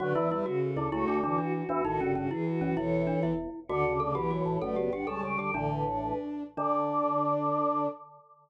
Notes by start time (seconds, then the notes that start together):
0.00 F#2 D3 F#3 F#4 B4 D5
0.15 E2 E3 E4
0.31 E2 E3 G3 E4 B4
0.46 C#3 F#4
0.62 A4
0.76 D2 D3 E4 A4
0.91 C#2 C#3 A3 E4 F#4 A4
1.08 D2 D3 D4
1.23 D2 D3 E3 D4 F#4
1.38 D4 F#4
1.53 F#4
1.69 E2 E3 D4 F#4
1.84 A1 A2 D#3 D#4 F#4 A4
2.00 G1 G2 C#3 C#4
2.15 G1 G2 C#3 C#4 F#4
2.31 E3 E4 G#4
2.46 F#4
2.60 F#1 F#2 C#4 F#4
2.77 E1 E2 E3 E4 A4 C#5
3.07 D4
3.22 E1 E2 E4
3.68 D2 D3 F#4 D5 F#5
3.85 C#3
3.99 C#3 A4 D5
4.15 B1 B2 E3 G4
4.31 F#4 C#5
4.45 A1 A2 C#5
4.61 F#1 F#2 A3 A4 B4 D5
4.76 B3 G4
4.92 G1 G2 D4 G4 F#5
5.07 C#2 C#3 G3 A4 A5
5.23 C#2 C#3 G5
5.38 D2 D3 G4 G5
5.54 A1 A2 D3 D4 D5
5.71 B4
5.86 D4 C#5
6.03 B4
6.57 D3 D4 D5